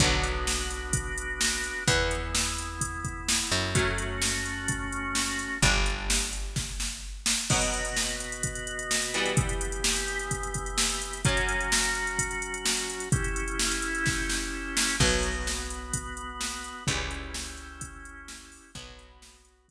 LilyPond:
<<
  \new Staff \with { instrumentName = "Overdriven Guitar" } { \time 4/4 \key b \minor \tempo 4 = 128 <d fis b>1 | <e b>1 | <fis a cis'>1 | <g d'>1 |
<b, fis b>2.~ <b, fis b>8 <e g b>8~ | <e g b>1 | <fis, fis cis'>1 | r1 |
<fis b>1 | <e g cis'>1 | <fis b>1 | }
  \new Staff \with { instrumentName = "Drawbar Organ" } { \time 4/4 \key b \minor <b d' fis'>1 | <b e'>1 | <a cis' fis'>1 | r1 |
<b, b fis'>1 | <e b g'>1 | <fis cis' fis'>1 | <cis' e' g'>1 |
<b fis'>1 | <cis' e' g'>1 | <b fis'>1 | }
  \new Staff \with { instrumentName = "Electric Bass (finger)" } { \clef bass \time 4/4 \key b \minor b,,1 | e,2.~ e,8 fis,8~ | fis,1 | g,,1 |
r1 | r1 | r1 | r1 |
b,,1 | cis,1 | b,,1 | }
  \new DrumStaff \with { instrumentName = "Drums" } \drummode { \time 4/4 <hh bd>8 hh8 sn8 hh8 <hh bd>8 hh8 sn8 hh8 | <hh bd>8 hh8 sn8 hh8 <hh bd>8 <hh bd>8 sn8 hh8 | <hh bd>8 hh8 sn8 hh8 <hh bd>8 hh8 sn8 hh8 | <hh bd>8 hh8 sn8 hh8 <bd sn>8 sn8 r8 sn8 |
<cymc bd>16 hh16 hh16 hh16 sn16 hh16 hh16 hh16 <hh bd>16 hh16 hh16 hh16 sn16 hh16 hh16 hh16 | <hh bd>16 hh16 hh16 hh16 sn16 hh16 hh16 hh16 <hh bd>16 hh16 <hh bd>16 hh16 sn16 hh16 hh16 hh16 | <hh bd>16 hh16 hh16 hh16 sn16 hh16 hh16 hh16 <hh bd>16 hh16 hh16 hh16 sn16 hh16 hh16 hh16 | <hh bd>16 hh16 hh16 hh16 sn16 hh16 hh16 hh16 <bd sn>8 sn8 r8 sn8 |
<cymc bd>8 hh8 sn8 hh8 <hh bd>8 hh8 sn8 hh8 | <hh bd>8 hh8 sn8 hh8 <hh bd>8 hh8 sn8 hho8 | <hh bd>8 hh8 sn8 hh8 <hh bd>4 r4 | }
>>